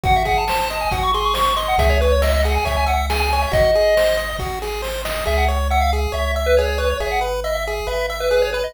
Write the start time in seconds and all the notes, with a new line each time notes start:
0.04 G#1 F#4 F#5, kick, closed hi-hat
0.16 E5
0.25 G#4 F#5, kick, closed hi-hat
0.38 A5
0.48 C5, snare
0.60 A5
0.70 D#5, snare, closed hi-hat
0.81 G#5
0.91 G#1 F#4 F#5, kick, closed hi-hat
1.03 C#6
1.14 G#4 C6, closed hi-hat
1.24 C#6
1.34 C5 C#6, snare
1.46 C#6
1.57 D#5 C6, closed hi-hat
1.68 F#5
1.78 C#2 G#4 E5, kick, closed hi-hat
1.90 C#5
2.01 B4 C#5, closed hi-hat
2.12 C#5
2.22 D#5 E5, snare
2.33 D#5
2.44 G#4 F#5, snare, closed hi-hat
2.55 G#5
2.65 C#2 C#5 E5, kick, closed hi-hat
2.77 G#5
2.86 E5 F#5, closed hi-hat
3.10 G#4 G#5, snare
3.20 G#5
3.30 C#5 G#5, closed hi-hat
3.42 E5
3.52 G#1 F#4 D#5, kick, closed hi-hat
3.74 G#4, closed hi-hat
3.97 C5, snare
4.17 D#5, snare, closed hi-hat
4.39 G#1 F#4, kick, snare
4.62 G#4, snare
4.82 C5, snare
5.05 D#5, snare
5.26 C#2 G#4 E5
5.38 F#5
5.48 C#5
5.70 E5 F#5
5.81 F5
5.93 G#4
6.12 C#2 C#5 E5
6.35 E5
6.46 B4
6.57 G#4 C#5
6.68 C#5
6.78 B4 C#5
6.90 C#5
7.00 G#1 G#4 E5
7.11 F#5
7.21 B4
7.44 D#5 E5
7.55 E5
7.67 G#4
7.87 G#1 B4 E5
8.10 E5
8.20 B4
8.31 G#4 B4
8.42 C#5
8.53 B4
8.64 D#5